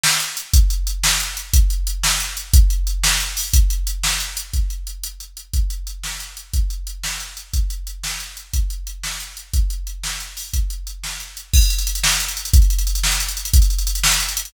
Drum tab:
CC |------|------------|------------|------------|
HH |--x-x-|x-x-x---x-x-|x-x-x---x-x-|x-x-x---x-o-|
SD |o-----|------o-----|------o-----|------o-----|
BD |------|o-----------|o-----------|o-----------|

CC |------------|------------|------------|------------|
HH |x-x-x---x-x-|x-x-x-x-x-x-|x-x-x---x-x-|x-x-x---x-x-|
SD |------o-----|------------|------o-----|------o-----|
BD |o-----------|o-----------|o-----------|o-----------|

CC |------------|------------|------------|------------|
HH |x-x-x---x-x-|x-x-x---x-x-|x-x-x---x-o-|x-x-x---x-x-|
SD |------o-----|------o-----|------o-----|------o-----|
BD |o-----------|o-----------|o-----------|o-----------|

CC |x-----------|------------|------------|
HH |-xxxxx-xxxxx|xxxxxx-xxxxx|xxxxxx-xxxxx|
SD |------o-----|------o-----|------o-----|
BD |o-----------|o-----------|o-----------|